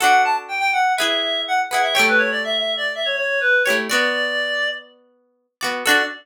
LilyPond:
<<
  \new Staff \with { instrumentName = "Clarinet" } { \time 4/4 \key d \major \tempo 4 = 123 fis''8 a''16 r16 g''16 g''16 fis''8 e''4 fis''16 r16 fis''16 e''16 | g''16 b'16 cis''16 d''16 \tuplet 3/2 { e''8 e''8 d''8 } e''16 cis''16 cis''8 b'8 cis''16 r16 | d''2 r2 | d''4 r2. | }
  \new Staff \with { instrumentName = "Pizzicato Strings" } { \time 4/4 \key d \major <d' fis' a'>2 <e' gis' b'>4. <e' gis' b'>8 | <a e' g' cis''>2.~ <a e' g' cis''>8 <a e' g' cis''>8 | <b fis' d''>2.~ <b fis' d''>8 <b fis' d''>8 | <d' fis' a'>4 r2. | }
>>